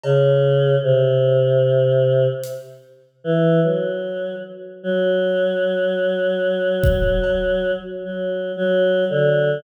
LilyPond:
<<
  \new Staff \with { instrumentName = "Choir Aahs" } { \clef bass \time 6/4 \tempo 4 = 75 cis4 c2 r4 e8 fis4 r8 | fis1 \tuplet 3/2 { fis4 fis4 d4 } | }
  \new DrumStaff \with { instrumentName = "Drums" } \drummode { \time 6/4 cb4 r4 r4 hh4 r4 r4 | r4 r4 r8 bd8 cb4 r4 r4 | }
>>